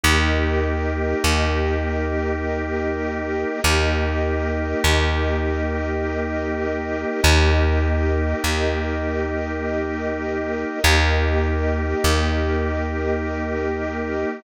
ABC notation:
X:1
M:3/4
L:1/8
Q:1/4=50
K:Ebmix
V:1 name="Drawbar Organ"
[B,EG]6 | [B,EG]6 | [B,EG]6 | [B,EG]6 |]
V:2 name="String Ensemble 1"
[GBe]6 | [GBe]6 | [GBe]6 | [GBe]6 |]
V:3 name="Electric Bass (finger)" clef=bass
E,,2 E,,4 | E,,2 E,,4 | E,,2 E,,4 | E,,2 E,,4 |]